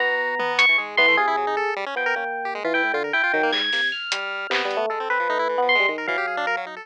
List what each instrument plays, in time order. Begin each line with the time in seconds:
0.00 electric piano 1 B3 A#5, lead 1 (square) F#4
0.39 lead 1 (square) B3, high tom
0.59 electric piano 1 C#6, closed hi-hat
0.69 lead 1 (square) E3
0.78 electric piano 1 G#2 G#4, lead 1 (square) G#3
0.97 electric piano 1 E3 C6, lead 1 (square) B3, high tom
1.08 lead 1 (square) A3
1.17 electric piano 1 C3 G#4, lead 1 (square) F4
1.27 lead 1 (square) E4
1.37 lead 1 (square) F#3
1.47 lead 1 (square) D#4
1.57 lead 1 (square) A4
1.76 lead 1 (square) G3
1.86 lead 1 (square) C#4
1.96 lead 1 (square) F3, electric piano 1 B3 G5
2.06 lead 1 (square) A#4
2.16 electric piano 1 A#3, lead 1 (square) C#4
2.45 lead 1 (square) G4
2.55 lead 1 (square) G#3
2.64 electric piano 1 E3, lead 1 (square) F4
2.74 lead 1 (square) E4, electric piano 1 G5
2.84 electric piano 1 A2
2.94 electric piano 1 D3, lead 1 (square) F4
3.04 lead 1 (square) A#4
3.13 lead 1 (square) E4, electric piano 1 G5
3.23 lead 1 (square) F4
3.33 electric piano 1 D#3, lead 1 (square) F#3
3.43 lead 1 (square) A#3
3.52 electric piano 1 G#2 G#6, lead 1 (square) G3, clap
3.73 electric piano 1 C3, lead 1 (square) A#3, snare
3.92 electric piano 1 F6
4.12 lead 1 (square) G3, closed hi-hat
4.50 electric piano 1 C3, lead 1 (square) B3, clap
4.65 electric piano 1 G3
4.71 closed hi-hat
4.77 electric piano 1 A3
4.90 lead 1 (square) G#3, electric piano 1 A4
5.00 lead 1 (square) C4
5.10 lead 1 (square) C4, electric piano 1 B4
5.20 lead 1 (square) F3
5.29 electric piano 1 A3, lead 1 (square) D#4
5.39 lead 1 (square) E4
5.49 lead 1 (square) E3
5.58 electric piano 1 B3
5.62 lead 1 (square) F3
5.69 electric piano 1 C6
5.75 lead 1 (square) G#3
5.80 electric piano 1 G3
5.88 electric piano 1 D#3, lead 1 (square) G#3
5.98 lead 1 (square) A#4
6.07 lead 1 (square) E3, electric piano 1 F#3 F5, kick
6.18 lead 1 (square) G4
6.27 lead 1 (square) G#4
6.37 lead 1 (square) D4
6.47 lead 1 (square) A#4
6.57 lead 1 (square) F#3
6.67 lead 1 (square) D#4
6.76 lead 1 (square) A4